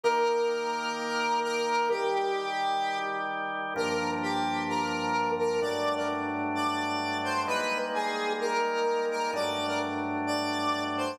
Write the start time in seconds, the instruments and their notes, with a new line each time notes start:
0.03 drawbar organ D#3 A#3 G4, lead 1 (square) A#4
1.43 lead 1 (square) A#4
1.90 drawbar organ D#3 G3 G4, lead 1 (square) G4
3.76 drawbar organ G2 F3 A#3 D4, lead 1 (square) A#4
4.22 lead 1 (square) G4
4.69 lead 1 (square) A#4
5.39 lead 1 (square) A#4
5.61 drawbar organ G2 F#3 A3 D4, lead 1 (square) D5
5.97 lead 1 (square) A#4
6.55 lead 1 (square) D5
7.24 lead 1 (square) C5
7.47 drawbar organ G3 G#3 A#3 D#4, lead 1 (square) B4
7.94 lead 1 (square) G#4
8.40 lead 1 (square) A#4
9.11 lead 1 (square) A#4
9.33 drawbar organ G2 F#3 A3 D4, lead 1 (square) D5
9.68 lead 1 (square) A#4
10.27 lead 1 (square) D5
10.97 lead 1 (square) C5